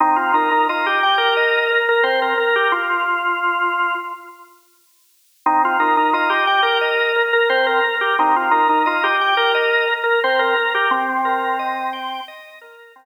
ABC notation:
X:1
M:4/4
L:1/16
Q:1/4=88
K:Cm
V:1 name="Drawbar Organ"
E F E E F G2 B4 B c B2 G | F8 z8 | E F E E F G2 B4 B c B2 G | E F E E F G2 B4 B c B2 G |
C8 z8 |]
V:2 name="Drawbar Organ"
C2 B2 e2 g2 e2 B2 C2 B2 | z16 | C2 B2 e2 g2 e2 B2 C2 B2 | C2 B2 e2 g2 e2 B2 C2 B2 |
z2 B2 e2 g2 e2 B2 C2 z2 |]